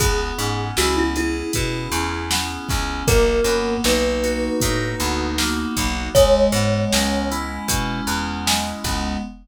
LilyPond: <<
  \new Staff \with { instrumentName = "Kalimba" } { \time 4/4 \key cis \minor \tempo 4 = 78 gis'4 fis'16 e'16 e'2~ e'8 | ais'4 b'2 r4 | cis''4. r2 r8 | }
  \new Staff \with { instrumentName = "Electric Piano 2" } { \time 4/4 \key cis \minor b8 cis'8 e'8 gis'8 e'8 cis'8 b8 cis'8 | ais8 b8 dis'8 fis'8 dis'8 b8 ais8 b8 | gis8 b8 cis'8 e'8 cis'8 b8 gis8 b8 | }
  \new Staff \with { instrumentName = "Electric Bass (finger)" } { \clef bass \time 4/4 \key cis \minor cis,8 gis,8 cis,4 b,8 e,4 cis,8 | b,,8 fis,8 b,,4 a,8 d,4 b,,8 | cis,8 gis,8 cis,4 b,8 e,4 cis,8 | }
  \new DrumStaff \with { instrumentName = "Drums" } \drummode { \time 4/4 <hh bd>8 hh8 sn8 hh8 <hh bd>8 hh8 sn8 <hh bd sn>8 | <hh bd>8 hh8 sn8 hh8 <hh bd>8 hh8 sn8 <hh bd sn>8 | <hh bd>8 hh8 sn8 hh8 <hh bd>8 hh8 sn8 <hh bd sn>8 | }
>>